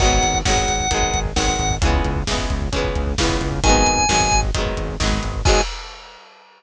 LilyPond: <<
  \new Staff \with { instrumentName = "Drawbar Organ" } { \time 4/4 \key gis \minor \tempo 4 = 132 fis''4 fis''2 fis''4 | r1 | gis''2 r2 | gis''4 r2. | }
  \new Staff \with { instrumentName = "Acoustic Guitar (steel)" } { \time 4/4 \key gis \minor <dis fis gis b>4 <dis fis gis b>4 <dis fis gis b>4 <dis fis gis b>4 | <cis e gis b>4 <cis e gis b>4 <cis e gis b>4 <cis e gis b>4 | <dis fis gis b>4 <dis fis gis b>4 <dis fis gis b>4 <dis fis gis b>4 | <dis fis gis b>4 r2. | }
  \new Staff \with { instrumentName = "Synth Bass 1" } { \clef bass \time 4/4 \key gis \minor gis,,8 gis,,8 gis,,8 gis,,8 gis,,8 gis,,8 gis,,8 gis,,8 | cis,8 cis,8 cis,8 cis,8 cis,8 cis,8 cis,8 cis,8 | gis,,8 gis,,8 gis,,8 gis,,8 gis,,8 gis,,8 gis,,8 gis,,8 | gis,4 r2. | }
  \new DrumStaff \with { instrumentName = "Drums" } \drummode { \time 4/4 <cymc bd>16 bd16 <hh bd>16 bd16 <bd sn>16 bd16 <hh bd>16 bd16 <hh bd>16 bd16 <hh bd>16 bd16 <bd sn>16 bd16 <hh bd>16 bd16 | <hh bd>16 bd16 <hh bd>16 bd16 <bd sn>16 bd16 <hh bd>16 bd16 <hh bd>16 bd16 <hh bd>16 bd16 <bd sn>16 bd16 <hh bd>16 bd16 | <hh bd>16 bd16 <hh bd>16 bd16 <bd sn>16 bd16 <hh bd>16 bd16 <hh bd>16 bd16 <hh bd>16 bd16 <bd sn>16 bd16 <hh bd>16 bd16 | <cymc bd>4 r4 r4 r4 | }
>>